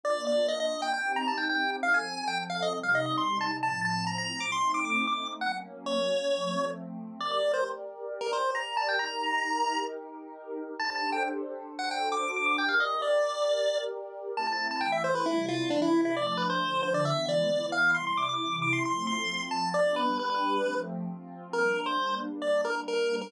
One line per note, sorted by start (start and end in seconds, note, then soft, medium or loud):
0.03 0.92 A#3 medium
0.03 0.92 D4 medium
0.03 0.92 F4 medium
0.03 0.25 D5 medium
0.27 0.47 D5 medium
0.48 0.59 D#5 medium
0.60 0.81 D#5 medium
0.82 0.93 G5 medium
0.94 1.82 C4 medium
0.94 1.82 D#4 medium
0.94 1.82 G4 medium
0.94 1.13 G5 medium
1.16 1.27 A#5 medium
1.28 1.38 A5 medium
1.38 1.48 G5 medium
1.49 1.71 G5 medium
1.83 2.72 F3 medium
1.83 2.72 C4 medium
1.83 2.72 A4 medium
1.83 1.93 F5 medium
1.94 2.25 G#5 medium
2.28 2.38 G5 medium
2.50 2.60 F5 medium
2.62 2.73 D#5 medium
2.73 3.61 C3 medium
2.73 3.61 G3 medium
2.73 3.61 D#4 medium
2.83 2.94 F5 medium
2.95 3.05 D#5 medium
3.06 3.17 D#5 medium
3.18 3.39 C6 medium
3.41 3.51 A5 medium
3.62 4.51 A2 medium
3.62 4.51 F3 medium
3.62 4.51 C4 medium
3.62 3.81 A5 medium
3.85 4.05 A5 medium
4.07 4.17 A#5 medium
4.18 4.39 A#5 medium
4.40 4.51 D6 medium
4.52 5.40 A3 medium
4.52 5.40 C4 medium
4.52 5.40 D#4 medium
4.52 4.72 C6 medium
4.74 4.85 D6 medium
4.85 4.95 D6 medium
4.96 5.06 D6 medium
5.07 5.28 D6 medium
5.41 6.30 F#3 medium
5.41 6.30 A#3 medium
5.41 6.30 C#4 medium
5.41 5.52 F#5 medium
5.86 6.65 C#5 medium
6.31 7.19 F3 medium
6.31 7.19 A3 medium
6.31 7.19 C4 medium
7.20 8.97 G4 medium
7.20 8.97 A#4 medium
7.20 8.97 D5 medium
7.20 7.31 D5 medium
7.31 7.52 D5 medium
7.54 7.64 C5 medium
8.21 8.31 A#4 medium
8.33 8.51 C5 medium
8.55 8.76 A#5 medium
8.77 8.87 A5 medium
8.89 8.99 G5 medium
8.99 10.77 D#4 medium
8.99 10.77 G4 medium
8.99 10.77 A#4 medium
8.99 9.80 A#5 medium
10.79 11.67 D4 medium
10.79 11.67 G4 medium
10.79 11.67 A4 medium
10.79 11.67 C5 medium
10.79 10.90 A5 medium
10.90 11.10 A5 medium
11.12 11.23 G5 medium
11.68 12.57 D4 medium
11.68 12.57 F#4 medium
11.68 12.57 A4 medium
11.68 12.57 C5 medium
11.79 11.89 F#5 medium
11.91 12.09 G5 medium
12.12 12.31 D6 medium
12.36 12.46 D6 medium
12.46 12.57 D6 medium
12.58 14.35 G4 medium
12.58 14.35 A#4 medium
12.58 14.35 D5 medium
12.58 12.69 G5 medium
12.69 12.79 F5 medium
12.80 13.01 D#5 medium
13.02 13.78 D5 medium
14.36 14.81 A3 medium
14.36 14.81 C4 medium
14.36 14.81 E4 medium
14.36 14.47 A5 medium
14.47 14.68 A5 medium
14.71 14.82 A5 medium
14.81 15.26 E3 medium
14.81 15.26 A3 medium
14.81 15.26 E4 medium
14.81 14.91 G5 medium
14.92 15.03 E5 medium
15.04 15.15 C5 medium
15.15 15.26 B4 medium
15.26 15.71 C3 medium
15.26 15.71 G3 medium
15.26 15.46 E4 medium
15.26 15.71 E4 medium
15.48 15.69 F4 medium
15.70 16.15 C3 medium
15.70 16.15 E3 medium
15.70 15.81 D4 medium
15.70 16.15 E4 medium
15.82 16.01 E4 medium
16.05 16.16 E4 medium
16.16 16.60 F3 medium
16.16 16.61 A3 loud
16.16 16.60 D4 medium
16.16 16.26 D5 medium
16.27 16.37 D5 medium
16.37 16.48 B4 medium
16.50 16.82 C5 medium
16.61 17.05 D3 medium
16.61 17.05 F3 medium
16.61 17.05 D4 medium
16.83 16.93 C5 medium
16.94 17.05 D5 medium
17.05 17.50 E3 medium
17.05 17.50 G#3 medium
17.05 17.50 B3 medium
17.05 17.26 E5 medium
17.29 17.66 D5 medium
17.50 17.95 E3 medium
17.50 17.95 B3 medium
17.50 17.94 E4 loud
17.72 17.91 F5 medium
17.94 18.39 C3 medium
17.94 18.39 G3 medium
17.94 18.39 E4 medium
17.94 18.05 C6 medium
18.07 18.17 C6 medium
18.17 18.28 D6 medium
18.29 18.56 D6 medium
18.40 18.84 C3 medium
18.40 18.84 E3 medium
18.40 18.84 E4 medium
18.62 18.73 D6 medium
18.73 18.83 C6 medium
18.85 19.29 F3 medium
18.85 19.29 A3 medium
18.85 19.29 C4 medium
18.85 19.06 C6 medium
19.07 19.43 C6 medium
19.29 19.74 F3 medium
19.29 19.74 C4 medium
19.29 19.74 F4 medium
19.51 19.69 A5 medium
19.74 20.18 G3 medium
19.74 20.18 B3 medium
19.74 20.18 D4 medium
19.74 19.95 D5 medium
19.96 20.18 B4 medium
20.19 20.63 G3 medium
20.19 20.63 D4 loud
20.19 20.63 G4 loud
20.19 20.29 B4 medium
20.30 20.75 B4 medium
20.64 21.08 F3 loud
20.64 21.08 A3 medium
20.64 21.08 C4 medium
21.09 21.53 F3 medium
21.09 21.53 C4 medium
21.09 21.53 F4 medium
21.53 23.31 G3 medium
21.53 23.31 A#3 medium
21.53 23.31 D4 medium
21.53 21.81 A#4 medium
21.86 22.15 C5 medium
22.42 22.61 D5 medium
22.65 22.75 A#4 medium
22.88 23.16 A#4 medium
23.21 23.32 A#4 medium